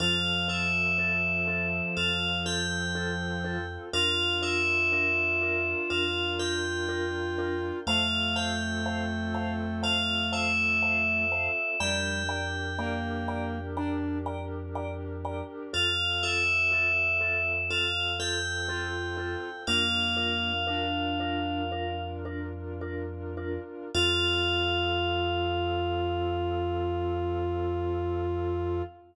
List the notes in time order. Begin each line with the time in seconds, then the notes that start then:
0.00 F2 F3 C4 F4 A4 F5
0.48 C4 F4 A4 E5
0.98 C4 F4 A4
1.48 C4 F4 A4
1.97 F2 C4 F4 A4 F5
2.46 C4 F4 A4 G5
2.95 C4 F4 A4
3.44 C4 F4 A4
3.93 F2 D4 F4 A#4 F5
4.42 D4 F4 A#4 E5
4.92 D4 F4 A#4
5.41 D4 F4 A#4
5.90 F2 D4 F4 A#4 F5
6.39 D4 F4 A#4 G5
6.89 D4 F4 A#4
7.38 D4 F4 A#4
7.86 F2 A3 C4 F4 A4 C5 F5 A5
8.36 C5 F5 G5 A5
8.86 C5 F5 A5
9.34 C5 F5 A5
9.83 C5 F5 A5
10.32 C5 E5 F5 A5
10.82 C5 F5 A5
11.32 C5 F5 A5
11.80 F2 G3 D4 G4 A#4 D5 G5 A#5
12.29 D5 G5 A#5
12.78 A#3 D5 G5 A#5
13.28 D5 G5 A#5
13.77 D4 D5 G5 A#5
14.26 D5 G5 A#5
14.75 D5 G5 A#5
15.25 D5 G5 A#5
15.73 F2 C4 F4 A4 F5
16.23 C4 F4 A4 E5
16.72 C4 F4 A4
17.21 C4 F4 A4
17.70 C4 F4 A4 F5
18.20 C4 F4 A4 G5
18.68 C4 F4 A4
19.17 C4 F4 A4
19.66 F2 A#3 D4 F4 A#4 F5
20.17 D4 F4 A#4
20.67 D4 F4 A#4
21.20 D4 F4 A#4
21.72 D4 F4 A#4
22.25 D4 F4 A#4
22.81 D4 F4 A#4
23.37 D4 F4 A#4
23.94 F2 C4 F4 A4 F5